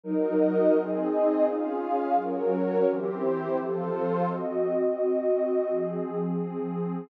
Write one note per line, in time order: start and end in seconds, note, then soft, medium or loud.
0.04 0.73 F#3 medium
0.04 0.73 D#4 medium
0.04 0.74 F#4 medium
0.04 0.73 A#4 medium
0.04 0.74 A#4 medium
0.04 0.74 D#5 medium
0.74 1.44 C4 loud
0.74 1.45 C4 medium
0.74 1.45 D#4 medium
0.74 1.44 G#4 medium
0.74 1.44 D#5 medium
1.44 2.14 C#4 medium
1.44 2.15 C#4 medium
1.44 2.14 F4 medium
1.44 2.14 G#4 medium
1.44 2.15 G#4 medium
1.44 2.15 F5 medium
2.14 2.84 F#3 medium
2.14 2.84 C#4 medium
2.14 2.85 F#4 loud
2.14 2.84 A#4 medium
2.14 2.85 A#4 medium
2.14 2.85 C#5 medium
2.86 3.56 E3 medium
2.86 3.55 C4 medium
2.86 3.56 E4 medium
2.86 3.56 G4 medium
2.86 3.56 C5 loud
3.56 4.26 F3 medium
3.56 4.26 C4 medium
3.56 4.27 F4 loud
3.56 4.26 A4 medium
3.56 4.27 A4 loud
3.56 4.27 C5 loud
4.27 5.67 C4 medium
4.27 5.67 F#4 medium
4.27 5.67 D#5 medium
5.69 7.08 F3 medium
5.69 7.08 C4 medium
5.69 7.08 G#4 medium